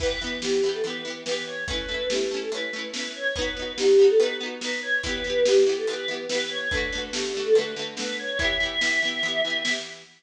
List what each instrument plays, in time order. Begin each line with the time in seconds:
0.00 acoustic guitar (steel) E3 B3, choir aahs B4, kick, crash
0.06 acoustic guitar (steel) G4
0.21 acoustic guitar (steel) E3 B3
0.27 acoustic guitar (steel) G4
0.42 acoustic guitar (steel) E3 B3, choir aahs G4, snare
0.47 acoustic guitar (steel) G4
0.63 acoustic guitar (steel) E3 B3
0.69 acoustic guitar (steel) G4
0.73 choir aahs A4
0.83 acoustic guitar (steel) E3 B3, choir aahs B4, closed hi-hat
0.90 acoustic guitar (steel) G4
1.05 acoustic guitar (steel) E3 B3
1.10 acoustic guitar (steel) G4
1.25 acoustic guitar (steel) E3 B3, choir aahs B4, snare
1.31 acoustic guitar (steel) G4
1.46 choir aahs C#5
1.67 acoustic guitar (steel) A3 C#4, choir aahs B4, kick, closed hi-hat
1.73 acoustic guitar (steel) E4
1.88 acoustic guitar (steel) A3 C#4
1.94 acoustic guitar (steel) E4
2.10 acoustic guitar (steel) A3 C#4, choir aahs G4, snare
2.15 acoustic guitar (steel) E4
2.31 acoustic guitar (steel) A3 C#4
2.36 acoustic guitar (steel) E4
2.41 choir aahs A4
2.52 acoustic guitar (steel) A3 C#4, choir aahs B4, closed hi-hat
2.57 acoustic guitar (steel) E4
2.73 acoustic guitar (steel) A3 C#4
2.78 acoustic guitar (steel) E4
2.93 acoustic guitar (steel) A3 C#4, choir aahs B4, snare
2.99 acoustic guitar (steel) E4
3.15 choir aahs C#5
3.36 acoustic guitar (steel) B3 D#4, choir aahs B4, kick, closed hi-hat
3.41 acoustic guitar (steel) F#4
3.56 acoustic guitar (steel) B3 D#4
3.62 acoustic guitar (steel) F#4
3.78 acoustic guitar (steel) B3 D#4, choir aahs G4, snare
3.83 acoustic guitar (steel) F#4
3.99 acoustic guitar (steel) B3 D#4
4.04 acoustic guitar (steel) F#4
4.10 choir aahs A4
4.19 acoustic guitar (steel) B3 D#4, choir aahs B4, closed hi-hat
4.25 acoustic guitar (steel) F#4
4.40 acoustic guitar (steel) B3 D#4
4.46 acoustic guitar (steel) F#4
4.61 acoustic guitar (steel) B3 D#4, choir aahs B4, snare
4.67 acoustic guitar (steel) F#4
4.82 choir aahs C#5
5.03 acoustic guitar (steel) E3 B3, choir aahs B4, kick, closed hi-hat
5.09 acoustic guitar (steel) G4
5.24 acoustic guitar (steel) E3 B3
5.30 acoustic guitar (steel) G4
5.45 acoustic guitar (steel) E3 B3, choir aahs G4, snare
5.51 acoustic guitar (steel) G4
5.66 acoustic guitar (steel) E3 B3
5.72 acoustic guitar (steel) G4
5.77 choir aahs A4
5.87 acoustic guitar (steel) E3 B3, choir aahs B4, closed hi-hat
5.93 acoustic guitar (steel) G4
6.08 acoustic guitar (steel) E3 B3
6.13 acoustic guitar (steel) G4
6.29 acoustic guitar (steel) E3 B3, choir aahs B4, snare
6.35 acoustic guitar (steel) G4
6.50 choir aahs C#5
6.70 acoustic guitar (steel) D3, choir aahs B4, kick, closed hi-hat
6.74 acoustic guitar (steel) A3 F#4
6.92 acoustic guitar (steel) D3 A3
6.98 acoustic guitar (steel) F#4
7.13 acoustic guitar (steel) D3 A3, choir aahs G4, snare
7.18 acoustic guitar (steel) F#4
7.34 acoustic guitar (steel) D3 A3
7.40 acoustic guitar (steel) F#4
7.45 choir aahs A4
7.54 acoustic guitar (steel) D3, choir aahs B4, closed hi-hat
7.58 acoustic guitar (steel) A3 F#4
7.76 acoustic guitar (steel) D3 A3
7.82 acoustic guitar (steel) F#4
7.97 acoustic guitar (steel) D3 A3, choir aahs B4, snare
8.02 acoustic guitar (steel) F#4
8.19 choir aahs C#5
8.39 acoustic guitar (steel) E3 B3, choir aahs E5, kick, closed hi-hat
8.44 acoustic guitar (steel) G4
8.60 acoustic guitar (steel) E3 B3
8.65 acoustic guitar (steel) G4
8.81 acoustic guitar (steel) E3 B3, snare
8.87 acoustic guitar (steel) G4
9.02 acoustic guitar (steel) E3 B3
9.08 acoustic guitar (steel) G4
9.23 acoustic guitar (steel) E3 B3, closed hi-hat
9.28 acoustic guitar (steel) G4
9.44 acoustic guitar (steel) E3 B3
9.50 acoustic guitar (steel) G4
9.65 acoustic guitar (steel) E3 B3, snare
9.71 acoustic guitar (steel) G4